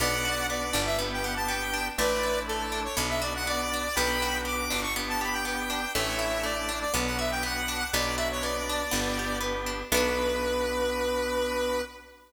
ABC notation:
X:1
M:4/4
L:1/16
Q:1/4=121
K:Bm
V:1 name="Lead 1 (square)"
[df]4 d3 e z g f a g4 | [Bd]4 A3 c z e d f d4 | [gb]4 d'3 c' z a b g g4 | [ce]4 d3 d z f e g f4 |
d2 e c d8 z4 | B16 |]
V:2 name="Drawbar Organ"
[B,DF]8 [B,DG]8 | [A,DE]8 [B,DF]8 | [B,DF]8 [B,DG]8 | [A,DE]8 [B,DF]8 |
[B,DF]8 [B,DG]8 | [B,DF]16 |]
V:3 name="Pizzicato Strings"
B,2 F2 B,2 D2 B,2 G2 B,2 D2 | A,2 E2 A,2 D2 B,2 F2 B,2 D2 | B,2 F2 B,2 D2 B,2 G2 B,2 D2 | A,2 E2 A,2 D2 B,2 F2 B,2 D2 |
B,2 F2 B,2 D2 B,2 G2 B,2 D2 | [B,DF]16 |]
V:4 name="Electric Bass (finger)" clef=bass
B,,,6 G,,,10 | A,,,8 B,,,8 | B,,,6 G,,,10 | A,,,8 B,,,8 |
B,,,8 G,,,8 | B,,,16 |]